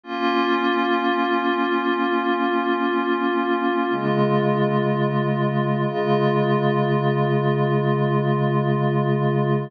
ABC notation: X:1
M:6/8
L:1/8
Q:3/8=62
K:Db
V:1 name="Pad 5 (bowed)"
[B,DF]6- | [B,DF]6 | [D,A,F]6 | [D,A,F]6- |
[D,A,F]6 |]